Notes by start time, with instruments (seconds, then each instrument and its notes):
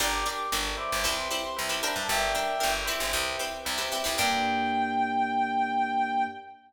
0.00 electric bass (finger) G1, pizzicato strings D4 G4 A#4, electric piano 1 A#4 D5 G5, clarinet A#5
0.13 clarinet D6
0.26 pizzicato strings D4 G4 A#4, clarinet D6
0.52 electric bass (finger) G1, pizzicato strings D4 G4 A#4, electric piano 1 A#4 D5 G5
0.77 electric piano 1 B4 C5 E5 G5, clarinet D6
0.92 electric bass (finger) G1
1.04 electric bass (finger) C2, pizzicato strings C4 E4 G4 B4
1.17 clarinet C6
1.31 pizzicato strings C4 E4 G4 B4
1.43 clarinet C6
1.56 electric bass (finger) C2, electric piano 1 B4 C5 E5 G5
1.69 pizzicato strings C4 E4 G4 B4
1.82 pizzicato strings D4 G4 A#4, clarinet B5
1.96 electric bass (finger) G2, clarinet A5
2.07 electric bass (finger) G1, electric piano 1 A#4 D5 G5, clarinet E5 G5
2.35 pizzicato strings D4 G4 A#4
2.59 pizzicato strings D4 G4 A#4, electric piano 1 A#4 D5 G5
2.63 electric bass (finger) G1
2.86 pizzicato strings C4 E4 G4 B4, electric piano 1 B4 C5 E5 G5
3.00 electric bass (finger) G1
3.13 electric bass (finger) C2
3.39 pizzicato strings C4 E4 G4 B4
3.65 electric bass (finger) C2, electric piano 1 B4 C5 E5 G5
3.78 pizzicato strings C4 E4 G4 B4
3.92 pizzicato strings C4 E4 G4 B4
4.04 electric bass (finger) C2, pizzicato strings C4 E4 G4 B4
4.17 electric bass (finger) G2, electric piano 1 A#3 D4 G4, pizzicato strings D4 G4 A#4, clarinet G5